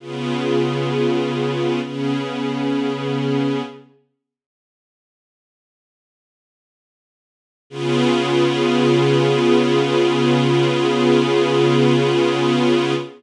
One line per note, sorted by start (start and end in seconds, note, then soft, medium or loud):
0.00 1.80 C#3 medium
0.00 1.80 B3 medium
0.00 1.81 F4 medium
0.00 1.80 G#4 medium
1.81 3.62 C#3 medium
1.81 3.62 B3 medium
1.81 3.62 C#4 medium
1.81 3.62 G#4 medium
7.70 12.94 C#3 loud
7.70 12.94 B3 loud
7.70 12.94 F4 loud
7.70 12.94 G#4 loud